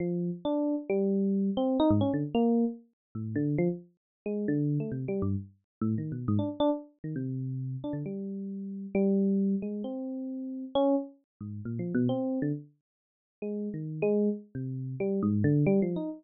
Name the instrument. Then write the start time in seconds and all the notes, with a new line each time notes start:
electric piano 1
0.00 F3
0.45 D4
0.90 G3
1.57 C4
1.80 D#4
1.90 G#2
2.01 C#4
2.14 D3
2.35 A#3
3.15 A2
3.36 D3
3.58 F3
4.26 G#3
4.48 D3
4.80 A3
4.92 C3
5.08 G3
5.22 G2
5.82 A2
5.98 D#3
6.12 B2
6.28 G#2
6.39 D4
6.60 D4
7.04 D#3
7.16 C3
7.84 D4
7.93 D3
8.06 G3
8.95 G3
9.62 G#3
9.84 C4
10.75 C#4
11.41 G#2
11.65 A#2
11.79 F3
11.95 B2
12.09 C4
12.42 D3
13.42 G#3
13.74 D#3
14.02 G#3
14.55 C3
15.00 G3
15.23 G#2
15.44 D3
15.67 G3
15.82 F3
15.96 D#4